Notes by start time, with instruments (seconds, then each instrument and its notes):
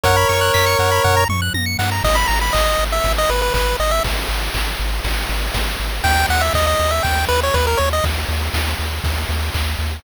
0.03 synth bass 1 F#2, lead 1 (square) A#4 C#5 F#5, kick, closed hi-hat
0.16 lead 1 (square) B5
0.29 synth bass 1 F#2, lead 1 (square) C#6, open hi-hat
0.41 lead 1 (square) F#6
0.54 synth bass 1 F#2, lead 1 (square) B6, kick, clap
0.66 lead 1 (square) C#7
0.79 synth bass 1 F#2, lead 1 (square) F#5, open hi-hat
0.91 lead 1 (square) B5
1.04 synth bass 1 F#2, lead 1 (square) F#5, kick, floor tom
1.17 lead 1 (square) A#5
1.29 synth bass 1 F#2, lead 1 (square) C#6, mid tom
1.42 lead 1 (square) F#6
1.54 synth bass 1 F#2, lead 1 (square) A#6, high tom
1.66 lead 1 (square) C#7
1.79 synth bass 1 G2, lead 1 (square) F#5, snare
1.92 lead 1 (square) A#5
2.04 synth bass 1 G#1, lead 1 (square) D#5, kick, crash
2.15 lead 1 (square) B5
2.27 synth bass 1 G#1, lead 1 (square) A#5, ride
2.41 lead 1 (square) B5
2.53 synth bass 1 G#1, lead 1 (square) D#5, kick, clap
2.79 synth bass 1 G#1, ride
2.92 lead 1 (square) E5
3.04 synth bass 1 G#1, kick, ride
3.18 lead 1 (square) D#5
3.29 synth bass 1 G#1, lead 1 (square) B4, ride
3.42 lead 1 (square) B4
3.54 synth bass 1 G#1, lead 1 (square) B4, kick, clap
3.79 synth bass 1 G#1, lead 1 (square) D#5, ride
3.91 lead 1 (square) E5
4.04 synth bass 1 G#1, kick, ride
4.29 synth bass 1 G#1, ride
4.54 synth bass 1 G#1, kick, clap
4.79 synth bass 1 G#1, ride
5.04 synth bass 1 G#1, kick, ride
5.29 synth bass 1 G#1, ride
5.54 synth bass 1 G#1, kick, snare
5.79 synth bass 1 G#1, ride
6.04 synth bass 1 D#2, lead 1 (square) G5, kick, ride
6.29 synth bass 1 D#2, lead 1 (square) F#5, ride
6.41 lead 1 (square) E5
6.54 synth bass 1 D#2, lead 1 (square) D#5, kick, clap
6.67 lead 1 (square) D#5
6.79 synth bass 1 D#2, ride
6.91 lead 1 (square) E5
7.03 synth bass 1 D#2, lead 1 (square) G5, kick, ride
7.28 synth bass 1 D#2, lead 1 (square) B4, ride
7.43 lead 1 (square) C#5
7.54 synth bass 1 D#2, lead 1 (square) B4, kick, clap
7.67 lead 1 (square) A#4
7.77 synth bass 1 D#2, lead 1 (square) C#5, ride
7.93 lead 1 (square) D#5
8.04 synth bass 1 D#2, kick, ride
8.29 synth bass 1 D#2, ride
8.54 synth bass 1 D#2, kick, snare
8.79 synth bass 1 D#2, ride
9.04 synth bass 1 D#2, kick, ride
9.29 synth bass 1 D#2, ride
9.54 synth bass 1 D#2, kick, clap
9.79 synth bass 1 D#2, ride